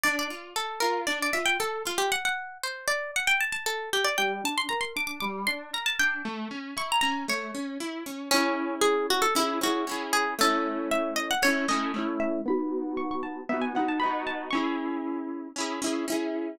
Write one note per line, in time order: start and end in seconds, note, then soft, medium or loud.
0.04 0.28 D4 loud
0.04 0.16 D5 medium
0.19 0.51 D5 medium
0.30 0.53 F4 medium
0.56 0.79 A4 medium
0.80 1.05 F4 medium
0.80 1.01 A#4 medium
1.07 1.31 D4 medium
1.07 1.19 D5 medium
1.22 1.35 D5 medium
1.33 1.57 F4 medium
1.33 1.46 E5 medium
1.46 1.58 G5 medium
1.60 1.83 A4 medium
1.85 2.09 F4 medium
1.85 1.99 F4 medium
1.98 2.10 G4 medium
2.12 2.24 F#5 medium
2.25 2.58 F#5 medium
2.63 2.87 C5 medium
2.88 3.11 D5 medium
3.16 3.28 F#5 medium
3.27 3.40 G5 medium
3.41 3.52 A5 medium
3.52 3.65 A5 medium
3.66 3.90 A4 medium
3.93 4.05 G4 medium
4.05 4.17 D5 medium
4.18 4.41 G3 loud
4.18 4.43 G5 medium
4.44 4.67 D4 medium
4.44 4.57 A5 medium
4.58 4.70 C6 medium
4.69 4.93 A#4 medium
4.69 4.81 A#5 medium
4.81 4.93 C6 medium
4.96 5.19 D4 medium
4.96 5.07 D6 medium
5.07 5.19 D6 medium
5.20 5.45 G3 medium
5.20 5.43 D6 medium
5.47 5.71 D4 medium
5.47 5.71 C6 medium
5.73 5.97 A#4 medium
5.73 5.86 A#5 medium
5.86 5.98 A5 medium
5.99 6.22 D4 medium
5.99 6.25 G5 medium
6.25 6.48 A3 medium
6.51 6.74 C#4 medium
6.77 7.00 E4 medium
6.77 6.90 C#6 medium
6.92 7.01 A#5 medium
7.01 7.26 C#4 medium
7.01 7.25 A#5 medium
7.28 7.51 A3 medium
7.28 8.23 C#5 medium
7.54 7.78 C#4 medium
7.80 8.03 E4 medium
8.06 8.29 C#4 medium
8.31 8.75 C#4 medium
8.31 9.27 C#4 loud
8.31 9.27 E4 loud
8.36 9.27 G#4 loud
8.81 9.07 G#4 medium
9.10 9.23 F#4 medium
9.22 9.34 A4 medium
9.35 9.59 C#4 medium
9.35 9.60 E4 medium
9.35 9.59 E4 loud
9.39 9.59 G#4 medium
9.61 9.85 C#4 medium
9.61 9.85 E4 loud
9.61 10.06 F#4 medium
9.66 9.85 G#4 medium
9.87 10.34 C#4 medium
9.87 10.34 E4 loud
9.91 10.34 G#4 loud
10.13 10.34 G#4 medium
10.38 11.34 A3 loud
10.38 11.34 C#4 loud
10.38 10.89 A4 medium
10.43 11.34 E4 loud
10.91 11.14 E5 medium
11.16 11.28 D#5 medium
11.31 11.43 F#5 medium
11.42 11.66 A3 medium
11.42 11.66 C#4 loud
11.42 11.68 C#5 medium
11.47 11.66 E4 medium
11.68 11.92 A3 medium
11.68 11.92 C#4 loud
11.68 12.12 D#5 medium
11.73 11.92 E4 medium
11.94 12.41 A3 medium
11.94 12.41 C#4 medium
11.98 12.41 E4 loud
12.20 12.41 E5 medium
12.45 13.41 B3 loud
12.45 13.41 D#4 loud
12.45 12.97 B5 medium
12.50 13.41 F#4 loud
12.97 13.09 C#6 medium
13.11 13.23 C#6 medium
13.23 13.45 A5 medium
13.49 13.73 B3 medium
13.49 13.73 D#4 medium
13.49 13.62 E5 medium
13.54 13.73 F#4 medium
13.62 13.74 G#5 medium
13.75 13.99 B3 loud
13.75 13.99 D#4 medium
13.75 13.89 F#5 medium
13.79 13.99 F#4 medium
13.88 14.01 A5 medium
14.00 14.49 B3 medium
14.00 14.49 D#4 medium
14.00 14.22 B5 medium
14.05 14.49 F#4 medium
14.27 14.49 A5 medium
14.51 15.48 C#4 loud
14.51 15.55 C#6 medium
14.55 15.48 E4 loud
14.55 15.48 G#4 loud
15.56 15.80 C#4 medium
15.56 15.80 E4 medium
15.60 15.80 G#4 medium
15.82 16.05 C#4 loud
15.82 16.05 E4 medium
15.86 16.05 G#4 medium
16.08 16.55 C#4 loud
16.08 16.55 E4 loud
16.12 16.55 G#4 medium